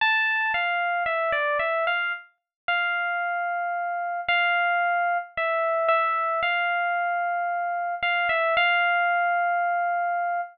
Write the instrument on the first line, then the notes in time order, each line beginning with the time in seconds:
electric piano 1
0.01 A5
0.54 F5
1.06 E5
1.32 D5
1.59 E5
1.87 F5
2.68 F5
4.29 F5
5.37 E5
5.88 E5
6.43 F5
8.03 F5
8.29 E5
8.57 F5